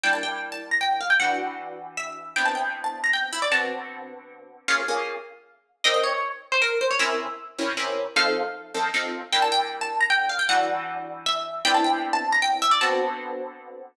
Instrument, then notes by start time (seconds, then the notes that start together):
orchestral harp
0.03 G3 A#3 D4 E4 G5
0.13 A5
0.23 G5
0.52 A5
0.71 A#5
0.81 G5
1.01 F5
1.10 G5
1.20 E3 G3 D4 F#4 F#5
1.97 E5
2.36 C3 B3 D4 E4 G5
2.45 A5
2.55 G5
2.84 A5
3.04 A#5
3.13 G5
3.33 E4
3.42 D5
3.51 D3 B3 C4 F#4 A5
4.68 A#3 C#4 F4 G#4 F5
4.88 A#3 C#4 F4 G#4
5.84 C4 D#4 G4 A#4 D#5
5.94 D#5
6.03 C#5
6.52 C5
6.62 A#4
6.81 C5
6.91 C#5
6.99 C3 C#4 E4 A#4 E5
7.58 C3 C#4 E4 A#4
7.77 C3 C#4 E4 A#4
8.16 F3 C4 D#4 A4 F5
8.74 F3 C4 D#4 A4
8.94 F3 C4 D#4 A4
9.32 G3 A#3 D4 E4 G5
9.42 A5
9.52 G5
9.81 A5
10.00 A#5
10.10 G5
10.29 F5
10.39 G5
10.49 E3 G3 D4 F#4 F#5
11.26 E5
11.65 C3 B3 D4 E4 G5
11.74 A5
11.84 G5
12.13 A5
12.32 A#5
12.42 G5
12.62 E5
12.71 D5
12.81 D3 B3 C4 F#4 A5